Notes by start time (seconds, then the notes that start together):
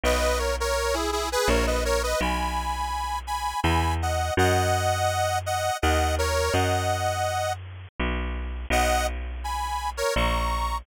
0.03 B1 B4 D#5
0.39 A#4 C#5
0.60 A#4 C#5
0.94 E4 G#4
1.12 E4 G#4
1.32 G#4 B4
1.48 A#1 A#4 C#5
1.67 B4 D#5
1.85 A#4 C#5
2.03 B4 D#5
2.21 B1 G#5 B5
3.27 G#5 B5
3.63 E2 G#5 B5
4.02 D#5 F#5
4.37 F#2 D#5 F#5
5.46 D#5 F#5
5.82 D#2 D#5 F#5
6.18 A#4 C#5
6.53 F#2 D#5 F#5
8.00 B1
8.70 B1 D#5 F#5
9.44 G#5 B5
9.97 A#4 C#5
10.16 A#1 A#5 C#6